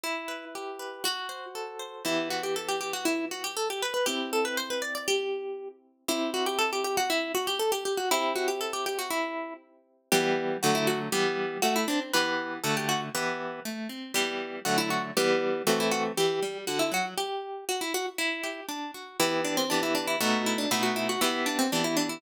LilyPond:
<<
  \new Staff \with { instrumentName = "Orchestral Harp" } { \time 2/4 \key e \minor \tempo 4 = 119 e'4 r4 | fis'4 r4 | e'8 fis'16 g'16 a'16 g'16 g'16 fis'16 | e'8 fis'16 g'16 a'16 g'16 b'16 b'16 |
g'8 a'16 b'16 c''16 b'16 d''16 d''16 | g'4. r8 | e'8 fis'16 g'16 a'16 g'16 g'16 fis'16 | e'8 fis'16 g'16 a'16 g'16 g'16 fis'16 |
e'8 fis'16 g'16 a'16 g'16 g'16 fis'16 | e'4 r4 | g'4 fis'16 e'16 fis'16 r16 | g'4 fis'16 e'16 d'16 r16 |
b'4 a'16 g'16 fis'16 r16 | b'4 r4 | g'4 fis'16 e'16 fis'16 r16 | g'4 fis'16 e'16 fis'16 r16 |
g'4 fis'16 e'16 fis'16 r16 | g'4 fis'16 e'16 fis'16 r16 | e'4 r4 | e'8 d'16 c'16 d'16 e'16 d'16 e'16 |
fis'8 e'16 d'16 e'16 fis'16 e'16 fis'16 | e'8 d'16 c'16 d'16 e'16 d'16 e'16 | }
  \new Staff \with { instrumentName = "Orchestral Harp" } { \time 2/4 \key e \minor e'8 b'8 g'8 b'8 | fis'8 c''8 a'8 c''8 | <e b g'>2~ | <e b g'>2 |
<c' e'>2~ | <c' e'>2 | <c' e' g'>2~ | <c' e' g'>2 |
<c' e' g'>2~ | <c' e' g'>2 | <e g b>4 <d fis a>4 | <e g b>4 a8 c'8 |
<e b g'>4 <d a fis'>4 | <e b g'>4 a8 c'8 | <e g b>4 <d fis a>4 | <e g b>4 <e a c'>4 |
e8 g8 d8 fis8 | r2 | r8 g'8 d'8 fis'8 | <e b g'>4 <e b g'>4 |
<b, a dis'>4 <b, a dis' fis'>4 | <e b g'>4 <e b g'>4 | }
>>